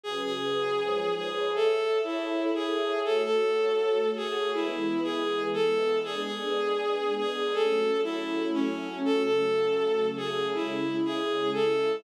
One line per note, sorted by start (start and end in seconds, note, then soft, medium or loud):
0.03 0.78 C#3 medium
0.03 0.78 F#3 medium
0.03 0.21 G#4 medium
0.03 0.78 G#4 medium
0.03 0.78 B4 medium
0.23 1.14 G#4 medium
0.79 1.53 G#2 medium
0.79 1.53 F3 medium
0.79 1.53 B4 medium
0.79 1.53 C#5 medium
1.16 1.51 G#4 medium
1.54 3.03 A4 medium
1.54 1.98 A4 medium
1.54 3.03 C#5 medium
1.54 3.03 E5 loud
2.04 2.52 E4 medium
2.54 3.00 G#4 medium
3.04 4.53 A3 medium
3.04 4.53 F#4 medium
3.04 3.22 A4 medium
3.04 4.53 C#5 medium
3.24 4.10 A4 medium
4.16 4.51 G#4 medium
4.54 6.03 E3 medium
4.54 6.03 G#3 medium
4.54 6.03 B3 medium
4.54 5.01 E4 medium
5.03 5.43 G#4 medium
5.53 5.98 A4 medium
6.04 7.53 G#3 medium
6.04 7.53 B3 medium
6.04 7.53 D4 loud
6.04 6.22 G#4 medium
6.23 7.15 G#4 medium
7.18 7.54 G#4 medium
7.53 9.03 F#3 medium
7.53 9.03 A3 medium
7.53 9.03 C#4 medium
7.53 8.01 A4 medium
8.04 8.48 E4 medium
8.54 8.99 C#4 medium
9.04 10.53 C#3 medium
9.04 10.53 F#3 medium
9.04 10.53 A3 medium
9.04 9.22 A4 medium
9.23 10.07 A4 medium
10.17 10.47 G#4 medium
10.54 12.03 C#3 medium
10.54 12.03 G#3 medium
10.54 12.03 E4 medium
10.54 10.97 E4 medium
11.05 11.50 G#4 medium
11.53 11.96 A4 medium